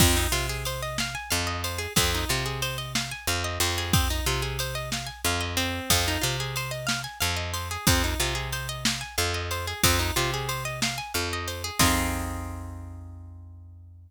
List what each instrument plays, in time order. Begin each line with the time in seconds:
0.00 electric bass (finger) F2, acoustic guitar (steel) C4, kick, crash
0.17 acoustic guitar (steel) D#4
0.32 electric bass (finger) C3, acoustic guitar (steel) F4
0.49 acoustic guitar (steel) G#4
0.65 acoustic guitar (steel) C5, ride
0.83 acoustic guitar (steel) D#5
0.98 acoustic guitar (steel) F5, snare
1.15 acoustic guitar (steel) G#5
1.30 electric bass (finger) F2, acoustic guitar (steel) F5
1.47 acoustic guitar (steel) D#5
1.64 acoustic guitar (steel) C5, ride
1.78 acoustic guitar (steel) G#4
1.96 electric bass (finger) F2, acoustic guitar (steel) C4, kick, ride
2.14 acoustic guitar (steel) D#4
2.29 electric bass (finger) C3, acoustic guitar (steel) F4
2.46 acoustic guitar (steel) G#4
2.62 acoustic guitar (steel) C5, ride
2.78 acoustic guitar (steel) D#5
2.95 acoustic guitar (steel) F5, snare
3.11 acoustic guitar (steel) G#5
3.27 electric bass (finger) F2, acoustic guitar (steel) F5
3.44 acoustic guitar (steel) D#5
3.60 electric bass (finger) F2, acoustic guitar (steel) C5, ride
3.78 acoustic guitar (steel) G#4
3.93 acoustic guitar (steel) C4, kick, ride
4.10 acoustic guitar (steel) D#4
4.26 electric bass (finger) C3, acoustic guitar (steel) F4
4.42 acoustic guitar (steel) G#4
4.59 acoustic guitar (steel) C5, ride
4.75 acoustic guitar (steel) D#5
4.92 acoustic guitar (steel) F5, snare
5.07 acoustic guitar (steel) G#5
5.24 electric bass (finger) F2, acoustic guitar (steel) F5
5.41 acoustic guitar (steel) D#5
5.57 acoustic guitar (steel) C4, ride
5.90 electric bass (finger) F2, kick, ride
6.08 acoustic guitar (steel) D#4
6.21 electric bass (finger) C3, acoustic guitar (steel) F4
6.40 acoustic guitar (steel) G#4
6.56 acoustic guitar (steel) C5, ride
6.71 acoustic guitar (steel) D#5
6.87 acoustic guitar (steel) F5, snare
7.04 acoustic guitar (steel) G#5
7.20 electric bass (finger) F2, acoustic guitar (steel) F5
7.36 acoustic guitar (steel) D#5
7.54 acoustic guitar (steel) C5, ride
7.71 acoustic guitar (steel) G#4
7.87 electric bass (finger) F2, acoustic guitar (steel) C4, kick, ride
8.04 acoustic guitar (steel) D#4
8.20 electric bass (finger) C3, acoustic guitar (steel) F4
8.35 acoustic guitar (steel) G#4
8.52 acoustic guitar (steel) C5, ride
8.69 acoustic guitar (steel) D#5
8.85 acoustic guitar (steel) F5, snare
9.01 acoustic guitar (steel) G#5
9.18 electric bass (finger) F2, acoustic guitar (steel) F5
9.34 acoustic guitar (steel) D#5
9.51 acoustic guitar (steel) C5, ride
9.67 acoustic guitar (steel) G#4
9.83 electric bass (finger) F2, acoustic guitar (steel) C4, kick, ride
9.99 acoustic guitar (steel) D#4
10.16 electric bass (finger) C3, acoustic guitar (steel) F4
10.34 acoustic guitar (steel) G#4
10.49 acoustic guitar (steel) C5, ride
10.65 acoustic guitar (steel) D#5
10.82 acoustic guitar (steel) F5, snare
10.98 acoustic guitar (steel) G#5
11.14 electric bass (finger) F2, acoustic guitar (steel) F5
11.33 acoustic guitar (steel) D#5
11.48 acoustic guitar (steel) C5, ride
11.64 acoustic guitar (steel) G#4
11.79 electric bass (finger) F2, acoustic guitar (steel) C4 D#4 F4 G#4, kick, crash